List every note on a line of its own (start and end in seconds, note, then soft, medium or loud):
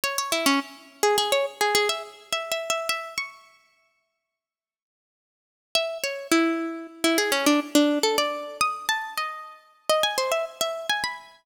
0.04 0.17 C#5 medium
0.18 0.32 C#5 medium
0.32 0.46 E4 medium
0.46 0.60 C#4 medium
1.03 1.17 G#4 medium
1.18 1.31 G#4 medium
1.32 1.46 C#5 medium
1.61 1.74 G#4 medium
1.75 1.88 G#4 medium
1.89 2.03 E5 medium
2.33 2.51 E5 medium
2.52 2.69 E5 medium
2.70 2.88 E5 medium
2.89 3.14 E5 medium
3.18 4.66 C#6 medium
5.75 5.98 E5 medium
6.04 6.27 C#5 medium
6.31 6.87 E4 medium
7.04 7.18 E4 medium
7.18 7.31 G#4 medium
7.32 7.45 C#4 medium
7.46 7.60 D4 medium
7.75 7.99 D4 medium
8.03 8.17 A4 medium
8.18 8.57 D5 medium
8.61 8.86 D#6 medium
8.89 9.14 A5 medium
9.17 9.73 D#5 medium
9.89 10.03 D#5 medium
10.03 10.17 G#5 medium
10.18 10.31 C5 medium
10.32 10.45 E5 medium
10.61 10.87 E5 medium
10.89 11.03 G#5 medium
11.04 11.43 B5 medium